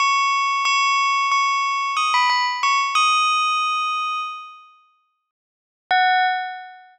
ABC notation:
X:1
M:9/8
L:1/16
Q:3/8=61
K:F#dor
V:1 name="Tubular Bells"
c'4 c'4 c'4 d' b b z c' z | d'8 z10 | f6 z12 |]